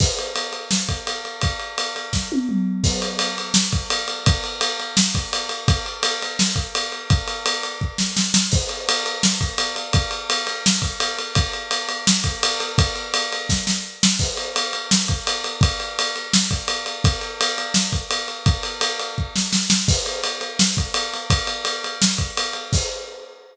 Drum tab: CC |x-------|--------|x-------|--------|
RD |-xxx-xxx|xxxx----|-xxx-xxx|xxxx-xxx|
SD |----o---|----o---|----o---|----o---|
T1 |--------|-----o--|--------|--------|
T2 |--------|------o-|--------|--------|
BD |o----o--|o---o---|o----o--|o----o--|

CC |--------|--------|x-------|--------|
RD |xxxx-xxx|xxxx----|-xxx-xxx|xxxx-xxx|
SD |----o---|-----ooo|----o---|----o---|
T1 |--------|--------|--------|--------|
T2 |--------|--------|--------|--------|
BD |o----o--|o---o---|o----o--|o----o--|

CC |--------|--------|x-------|--------|
RD |xxxx-xxx|xxxx----|-xxx-xxx|xxxx-xxx|
SD |----o---|----oo-o|----o---|----o---|
T1 |--------|--------|--------|--------|
T2 |--------|--------|--------|--------|
BD |o----o--|o---o---|o----o--|o----o--|

CC |--------|--------|x-------|--------|
RD |xxxx-xxx|xxxx----|-xxx-xxx|xxxx-xxx|
SD |----o---|-----ooo|----o---|----o---|
T1 |--------|--------|--------|--------|
T2 |--------|--------|--------|--------|
BD |o----o--|o---o---|o----o--|o----o--|

CC |x-------|
RD |--------|
SD |--------|
T1 |--------|
T2 |--------|
BD |o-------|